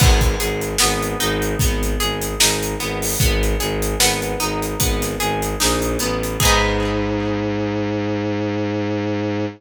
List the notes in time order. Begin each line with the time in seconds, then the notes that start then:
0.00 G#1 B3, kick, crash
0.21 kick, closed hi-hat
0.40 G#1 G#4, closed hi-hat
0.61 closed hi-hat
0.78 G#1 B3, snare
1.03 closed hi-hat
1.20 G#1 D#4, closed hi-hat
1.42 closed hi-hat
1.59 G#1 B3, kick, closed hi-hat
1.83 closed hi-hat
2.00 G#1 G#4, closed hi-hat
2.22 closed hi-hat
2.40 G#1 D#4, snare
2.62 closed hi-hat
2.80 G#1 B3, snare, closed hi-hat
3.02 open hi-hat
3.20 G#1 B3, kick, closed hi-hat
3.43 closed hi-hat
3.60 G#1 G#4, closed hi-hat
3.82 closed hi-hat
4.00 G#1 B3, snare
4.22 closed hi-hat
4.40 G#1 D#4, closed hi-hat
4.62 closed hi-hat
4.80 G#1 B3, kick, closed hi-hat
5.02 snare, closed hi-hat
5.20 G#1 G#4, closed hi-hat
5.42 closed hi-hat
5.60 A#1 D#4, snare
5.82 closed hi-hat
5.99 A1 B3, closed hi-hat
6.23 closed hi-hat
6.40 G#2 D#4 G#4, kick, crash
6.45 B3